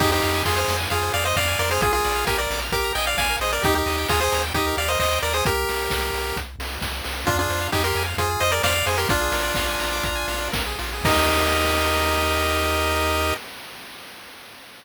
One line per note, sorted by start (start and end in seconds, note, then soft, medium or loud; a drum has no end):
0.00 0.20 F2 medium
0.00 0.11 D#4 loud
0.00 0.11 G4 loud
0.00 0.10 G#4 medium
0.00 kick loud
0.00 crash medium
0.11 0.43 D#4 medium
0.11 0.43 G4 loud
0.11 0.21 C5 medium
0.21 0.43 F2 medium
0.21 0.32 F5 medium
0.21 open hi-hat medium
0.34 0.44 G#5 medium
0.45 0.64 F2 medium
0.45 0.57 F4 medium
0.45 0.56 G#4 medium
0.45 0.56 C6 medium
0.45 kick medium
0.45 clap medium
0.56 0.77 G#4 medium
0.56 0.77 C5 medium
0.56 0.67 F6 medium
0.68 0.87 F2 medium
0.68 0.79 C6 medium
0.68 open hi-hat medium
0.78 0.88 G#5 medium
0.90 1.10 F2 medium
0.90 1.12 F4 medium
0.90 1.12 G#4 medium
0.90 1.00 F5 medium
0.90 kick medium
0.90 closed hi-hat medium
1.03 1.13 C5 medium
1.14 1.33 F2 medium
1.14 1.25 G#4 medium
1.14 1.24 D5 medium
1.14 1.24 F5 loud
1.14 open hi-hat medium
1.23 1.34 C5 medium
1.23 1.36 C5 medium
1.23 1.36 D#5 medium
1.36 1.55 F2 medium
1.36 1.59 D5 medium
1.36 1.47 F5 medium
1.36 1.59 F5 loud
1.36 kick medium
1.36 clap medium
1.47 1.58 G#5 medium
1.59 1.79 F2 medium
1.59 1.70 A#4 medium
1.59 1.70 D5 loud
1.59 1.70 C6 medium
1.59 open hi-hat medium
1.71 1.82 G#4 medium
1.71 1.82 C5 loud
1.71 1.81 F6 medium
1.81 2.00 A#1 medium
1.81 1.92 F4 medium
1.81 1.92 G#4 loud
1.81 1.93 G#4 medium
1.81 kick medium
1.81 closed hi-hat medium
1.93 2.25 F4 medium
1.93 2.25 G#4 loud
1.93 2.05 A#4 medium
2.04 2.25 A#1 medium
2.04 2.14 D5 medium
2.04 open hi-hat medium
2.16 2.26 F5 medium
2.27 2.47 A#1 medium
2.27 2.38 G4 medium
2.27 2.38 A#4 loud
2.27 2.37 G#5 medium
2.27 kick medium
2.27 snare medium
2.38 2.60 A#4 medium
2.38 2.60 D5 medium
2.38 2.49 A#5 medium
2.50 2.70 A#1 medium
2.50 2.62 D6 medium
2.50 open hi-hat medium
2.62 2.72 F6 medium
2.72 2.91 A#1 medium
2.72 2.93 G4 medium
2.72 2.93 A#4 loud
2.72 2.84 D6 medium
2.72 kick medium
2.72 closed hi-hat medium
2.84 2.94 A#5 medium
2.95 3.15 A#1 medium
2.95 3.06 D#5 medium
2.95 3.06 G5 medium
2.95 3.06 G#5 medium
2.95 open hi-hat medium
3.06 3.18 D5 medium
3.06 3.16 F5 medium
3.06 3.17 F5 medium
3.17 3.37 A#1 medium
3.17 3.28 D5 medium
3.17 3.36 F5 medium
3.17 3.36 G#5 loud
3.17 kick medium
3.17 snare medium
3.29 3.40 A#4 medium
3.40 3.59 A#1 medium
3.40 3.51 G#4 medium
3.40 3.52 C5 medium
3.40 3.52 D#5 medium
3.40 open hi-hat medium
3.52 3.62 A#4 medium
3.52 3.63 A#4 medium
3.52 3.63 D5 medium
3.62 3.83 D#2 medium
3.62 3.75 D#4 loud
3.62 3.72 G4 medium
3.62 3.75 G4 loud
3.62 kick medium
3.62 closed hi-hat medium
3.73 4.08 D#4 medium
3.73 4.08 G4 medium
3.73 3.84 A#4 medium
3.86 4.05 D#2 medium
3.86 3.96 D#5 medium
3.86 open hi-hat medium
3.98 4.08 G5 medium
4.08 4.29 D#2 medium
4.08 4.20 F4 medium
4.08 4.20 G#4 loud
4.08 4.19 A#5 medium
4.08 kick medium
4.08 clap medium
4.20 4.43 G#4 medium
4.20 4.43 C5 loud
4.20 4.31 D#6 medium
4.32 4.52 D#2 medium
4.32 4.43 A#5 medium
4.32 open hi-hat medium
4.43 4.53 G5 medium
4.54 4.73 D#2 medium
4.54 4.76 D#4 medium
4.54 4.76 G4 loud
4.54 4.66 D#5 medium
4.54 kick medium
4.54 closed hi-hat medium
4.67 4.77 A#4 medium
4.77 4.96 D#2 medium
4.77 4.88 G4 medium
4.77 4.89 D5 medium
4.77 4.89 F5 medium
4.77 open hi-hat medium
4.88 4.98 A#4 medium
4.88 4.99 C5 medium
4.88 4.99 D#5 medium
4.99 5.19 D#2 medium
4.99 5.19 C5 medium
4.99 5.19 D#5 loud
4.99 5.11 D#5 medium
4.99 kick medium
4.99 clap medium
5.12 5.22 G5 medium
5.22 5.42 D#2 medium
5.22 5.33 A#4 medium
5.22 5.33 D5 loud
5.22 5.34 A#5 medium
5.22 open hi-hat medium
5.33 5.45 G#4 medium
5.33 5.45 C5 medium
5.33 5.43 D#6 medium
5.45 5.65 C2 medium
5.45 6.37 G4 loud
5.45 6.37 A#4 loud
5.45 kick loud
5.45 closed hi-hat medium
5.69 5.89 C2 medium
5.69 open hi-hat medium
5.90 6.10 C2 medium
5.90 kick medium
5.90 snare medium
6.13 6.32 C2 medium
6.13 open hi-hat medium
6.36 6.56 C2 medium
6.36 kick medium
6.36 closed hi-hat medium
6.59 6.78 C2 medium
6.59 open hi-hat medium
6.81 7.01 C2 medium
6.81 kick medium
6.81 snare medium
7.04 7.25 C2 medium
7.04 open hi-hat medium
7.26 7.47 F2 medium
7.26 7.37 D4 loud
7.26 7.36 F4 loud
7.26 7.37 F4 loud
7.26 kick medium
7.26 closed hi-hat medium
7.39 7.68 D4 medium
7.39 7.68 F4 loud
7.39 7.49 G#4 medium
7.49 7.68 F2 medium
7.49 7.60 C5 medium
7.49 open hi-hat medium
7.61 7.71 F5 medium
7.72 7.93 F2 medium
7.72 7.83 D#4 medium
7.72 7.83 G4 loud
7.72 7.83 G#5 medium
7.72 kick medium
7.72 clap medium
7.84 8.03 G4 medium
7.84 8.03 A#4 loud
7.84 7.95 C6 medium
7.95 8.14 F2 medium
7.95 8.07 G#5 medium
7.95 open hi-hat medium
8.06 8.16 F5 medium
8.17 8.37 F2 medium
8.17 8.40 F4 medium
8.17 8.40 G#4 medium
8.17 8.28 C5 medium
8.17 kick medium
8.17 closed hi-hat medium
8.30 8.41 G#4 medium
8.40 8.60 F2 medium
8.40 8.50 F4 medium
8.40 8.51 C5 loud
8.40 8.51 D#5 loud
8.40 open hi-hat medium
8.52 8.62 G#4 medium
8.52 8.62 A#4 loud
8.52 8.62 D5 loud
8.63 8.83 F2 medium
8.63 8.74 C5 medium
8.63 8.86 D5 loud
8.63 8.86 F5 loud
8.63 kick medium
8.63 snare loud
8.75 8.85 F5 medium
8.86 9.06 F2 medium
8.86 8.97 G#4 medium
8.86 8.97 C5 medium
8.86 8.97 G#5 medium
8.86 open hi-hat medium
8.98 9.08 G4 medium
8.98 9.08 A#4 loud
8.98 9.09 C6 medium
9.09 9.29 A#1 medium
9.09 10.48 D4 loud
9.09 10.48 F4 loud
9.09 9.21 F4 medium
9.09 kick loud
9.09 closed hi-hat medium
9.21 9.32 G#4 medium
9.32 9.52 A#1 medium
9.32 9.43 A#4 medium
9.32 open hi-hat medium
9.43 9.53 D5 medium
9.54 9.76 A#1 medium
9.54 9.67 F5 medium
9.54 kick medium
9.54 snare medium
9.68 9.79 G#5 medium
9.79 10.00 A#1 medium
9.79 9.90 A#5 medium
9.79 open hi-hat medium
9.93 10.04 D6 medium
10.03 10.24 A#1 medium
10.03 10.16 A#5 medium
10.03 kick medium
10.03 closed hi-hat medium
10.16 10.27 G#5 medium
10.28 10.49 A#1 medium
10.28 10.40 F5 medium
10.28 open hi-hat medium
10.41 10.52 D5 medium
10.52 10.75 A#1 medium
10.52 10.63 A#4 medium
10.52 kick medium
10.52 snare loud
10.66 10.78 G#4 medium
10.79 11.01 A#1 medium
10.79 10.91 F4 medium
10.79 open hi-hat medium
10.93 11.05 G#4 medium
11.04 13.33 D#2 loud
11.04 13.34 D#4 loud
11.04 13.34 G4 loud
11.04 13.34 A#4 loud
11.04 13.34 D#5 loud
11.04 kick loud
11.04 crash loud